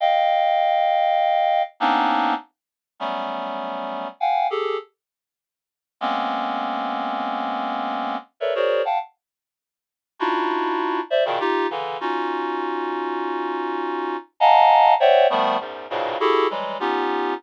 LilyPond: \new Staff { \time 5/4 \tempo 4 = 100 <ees'' f'' g''>2. <bes b c' des' d' ees'>4 r4 | <ges g a b des'>2 <f'' ges'' g'' aes''>8 <g' aes' a'>8 r2 | <aes bes b c' des'>1 <a' bes' b' des'' d'' e''>16 <ges' aes' bes' c'' des'' d''>8 <f'' ges'' g'' a''>16 | r2 <d' ees' e' f' ges'>4. <c'' d'' e''>16 <bes, b, des ees>16 <ees' f' g'>8 <des d e>8 |
<des' ees' f' ges'>1 <ees'' f'' ges'' aes'' a'' bes''>4 | <c'' des'' d'' e'' ges'' g''>8 <ees f g a b>8 <e, ges, aes,>8 <g, aes, a, bes, b, des>8 <e' ges' g' aes' a'>8 <e ges g aes>8 <b des' ees' f' g'>4 r4 | }